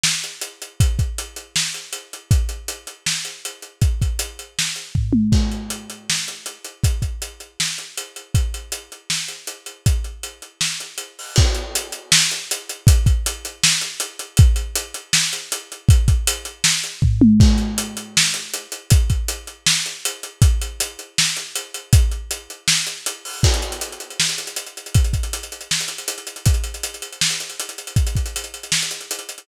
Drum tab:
CC |--------|----------------|----------------|----------------|
HH |--x-x-x-|x-x-x-x---x-x-x-|x-x-x-x---x-x-x-|x-x-x-x---x-----|
SD |o-------|--------o-------|--------o-------|--------o-------|
T1 |--------|----------------|----------------|--------------o-|
FT |--------|----------------|----------------|------------o---|
BD |--------|o-o-------------|o---------------|o-o---------o---|

CC |x---------------|----------------|----------------|----------------|
HH |--x-x-x---x-x-x-|x-x-x-x---x-x-x-|x-x-x-x---x-x-x-|x-x-x-x---x-x-o-|
SD |--------o-------|--------o-------|--------o-------|--------o-------|
T1 |----------------|----------------|----------------|----------------|
FT |----------------|----------------|----------------|----------------|
BD |o---------------|o-o-------------|o---------------|o---------------|

CC |x---------------|----------------|----------------|----------------|
HH |--x-x-x---x-x-x-|x-x-x-x---x-x-x-|x-x-x-x---x-x-x-|x-x-x-x---x-----|
SD |--------o-------|--------o-------|--------o-------|--------o-------|
T1 |----------------|----------------|----------------|--------------o-|
FT |----------------|----------------|----------------|------------o---|
BD |o---------------|o-o-------------|o---------------|o-o---------o---|

CC |x---------------|----------------|----------------|----------------|
HH |--x-x-x---x-x-x-|x-x-x-x---x-x-x-|x-x-x-x---x-x-x-|x-x-x-x---x-x-o-|
SD |--------o-------|--------o-------|--------o-------|--------o-------|
T1 |----------------|----------------|----------------|----------------|
FT |----------------|----------------|----------------|----------------|
BD |o---------------|o-o-------------|o---------------|o---------------|

CC |x---------------|----------------|----------------|----------------|
HH |-xxxxxxx-xxxxxxx|xxxxxxxx-xxxxxxx|xxxxxxxx-xxxxxxx|xxxxxxxx-xxxxxxx|
SD |--------o-------|--------o-------|--------o-------|--------o-------|
T1 |----------------|----------------|----------------|----------------|
FT |----------------|----------------|----------------|----------------|
BD |o---------------|o-o-------------|o---------------|o-o-------------|